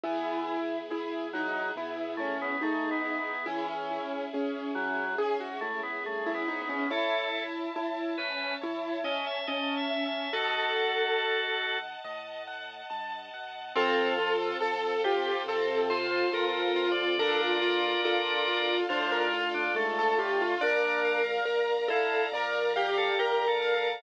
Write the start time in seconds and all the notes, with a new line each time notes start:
0.04 E2 E3 B3 E4 G#4
0.48 E4
0.89 E2 E4 G#4
1.33 F#3 D#4 E4
1.76 B2 B3 E4
2.17 A3 C#4 E4
2.42 B3
2.61 E2 A3 D#4 G#4
2.91 B3
3.05 E4
3.19 B3
3.46 C#2 E3 C#4 E4 G#4
3.68 C#4
3.91 E4
4.33 C#2 C#4 G#4
4.75 F#3 E4
5.18 G#2 C#4 G#4
5.40 F#4
5.61 A3 E4
5.83 B3
6.04 G2 A3 G#4
6.26 E4
6.34 B3
6.46 G#2 D#4 E4
6.62 B3
6.69 C#4
6.90 A1 E4 A4 C#5 E5 A5
7.34 E5
7.76 A1 E4 A5
8.18 C#4 B4 E5
8.61 E2 E4 C#5
9.04 C#4 D#5 E5
9.27 E5
9.47 A1 C#4 D#5 A5
9.77 E5
9.91 E5
10.06 E5
10.33 D#2 F#4 A4 D#5 F#5 A5
10.76 F#5
11.18 D#2 A5
11.62 F#5
12.04 A2 D#5
12.48 F#5
12.90 G2 A5
13.34 F#2 F#5
13.76 F2 C4 F4 A4
14.19 F4
14.60 F2 A4
15.04 F4 G4
15.46 C3 C4 A4
15.90 F4 C5
16.11 C5
16.32 F2 F4 A4 A#4
16.62 A#4
16.76 F4
16.92 D5
17.18 D2 D4 F4 A4 A#4 D5
17.41 F4
17.62 F4
18.05 D2 F4 A4
18.48 F4
18.89 A2 D4 F4 C5
19.12 A#4
19.34 F4
19.54 D4
19.74 G#2 A3 A4
19.99 A4
20.18 A2 F4 G4
20.42 F4
20.61 A#1 D4 A#4 D5 F5 A#5
21.05 F5
21.45 A#1 A#4 A#5
21.88 E4 A4 F5
22.32 F2 A#4 D5
22.76 G4 F5
22.98 A4
23.18 A#1 G4 A#4 A#5
23.48 A4
23.62 F5
23.75 A4